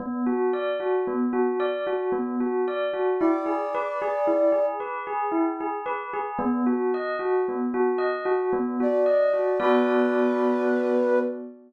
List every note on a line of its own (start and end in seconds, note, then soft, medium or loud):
0.00 0.23 B3 medium
0.26 0.50 F#4 medium
0.53 0.77 D5 medium
0.80 1.04 F#4 medium
1.07 1.31 B3 medium
1.33 1.57 F#4 medium
1.60 1.84 D5 medium
1.87 2.11 F#4 medium
2.12 2.36 B3 medium
2.40 2.64 F#4 medium
2.68 2.92 D5 medium
2.93 3.17 F#4 medium
3.19 3.45 E4 medium
3.19 4.66 D5 medium
3.46 3.70 G#4 medium
3.75 3.99 B4 medium
4.02 4.26 G#4 medium
4.27 4.51 E4 medium
4.52 4.76 G#4 medium
4.80 5.04 B4 medium
5.07 5.31 G#4 medium
5.32 5.56 E4 medium
5.60 5.84 G#4 medium
5.86 6.10 B4 medium
6.13 6.37 G#4 medium
6.39 6.63 B3 medium
6.66 6.90 F#4 medium
6.94 7.18 D#5 medium
7.19 7.43 F#4 medium
7.48 7.72 B3 medium
7.74 7.98 F#4 medium
7.98 8.22 D#5 medium
8.25 8.49 F#4 medium
8.53 8.77 B3 medium
8.80 9.04 F#4 medium
8.80 9.61 D5 medium
9.06 9.30 D#5 medium
9.33 9.57 F#4 medium
9.60 11.19 B3 loud
9.60 11.19 F#4 medium
9.60 11.19 B4 loud
9.60 11.19 D5 loud